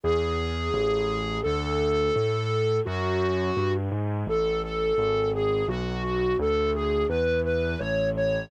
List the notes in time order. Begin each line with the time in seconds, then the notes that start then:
0.04 E2 G#4
0.74 A1
1.43 D2 A4
2.16 A2
2.85 F#2 F#4
3.57 G2
3.92 G#2
4.27 A1 A4
4.63 A4
4.98 G#1 A4
5.34 G#4
5.68 B1 F#4
6.03 F#4
6.39 D2 A4
6.75 G#4
7.09 E2 B4
7.44 B4
7.79 A1 C#5
8.16 C#5